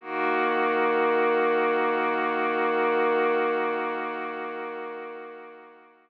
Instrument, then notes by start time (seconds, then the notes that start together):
pad 2 (warm)
0.01 D#3 A#3 F#4